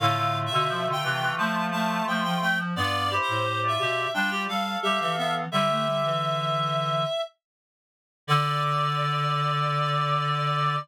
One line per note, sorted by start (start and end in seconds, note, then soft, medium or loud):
0.00 0.49 A2 medium
0.00 0.16 D3 medium
0.00 2.45 A3 medium
0.00 2.45 F4 medium
0.00 0.38 F5 medium
0.17 0.45 D3 medium
0.46 0.86 E5 medium
0.51 0.94 B2 medium
0.51 0.68 D3 loud
0.69 0.85 F3 medium
0.86 1.02 D3 medium
0.92 1.33 G5 medium
1.03 1.31 C3 medium
1.03 1.20 E3 medium
1.21 1.37 E3 medium
1.38 2.00 F3 medium
1.38 1.70 A3 medium
1.38 1.66 A5 medium
1.72 2.04 A3 medium
1.72 2.05 A5 medium
2.07 2.35 F3 medium
2.07 2.23 A3 medium
2.07 2.23 G5 medium
2.24 2.73 F3 medium
2.24 2.40 G5 medium
2.41 2.58 A3 medium
2.41 2.58 G5 medium
2.59 2.75 F3 medium
2.76 3.19 G2 medium
2.76 3.09 B3 medium
2.76 3.08 F4 medium
2.76 3.08 D5 medium
2.76 3.15 D5 loud
3.10 3.44 E4 medium
3.10 3.70 G4 medium
3.10 3.44 C5 medium
3.22 3.61 C5 medium
3.28 3.78 A2 medium
3.62 4.05 F4 medium
3.62 4.05 D5 medium
3.68 4.11 E5 medium
3.79 4.07 B2 medium
3.79 4.07 G4 medium
4.14 4.47 G3 medium
4.14 4.30 D4 medium
4.14 4.46 F4 medium
4.14 4.46 D5 medium
4.14 4.43 G5 medium
4.31 4.47 G4 medium
4.48 4.76 G3 medium
4.48 5.40 A4 medium
4.48 5.40 F5 medium
4.48 4.78 F5 medium
4.83 4.99 G3 medium
4.83 5.13 G4 medium
4.83 4.99 E5 medium
5.00 5.46 E3 medium
5.00 5.16 E5 medium
5.17 5.45 B3 medium
5.17 5.34 E5 medium
5.51 7.05 D3 medium
5.51 5.68 G3 medium
5.51 6.09 G4 medium
5.51 7.21 E5 medium
5.51 6.09 E5 medium
5.69 5.85 A3 medium
5.86 6.02 G3 medium
6.04 7.01 E3 medium
8.27 10.76 D3 loud
8.27 10.76 D5 loud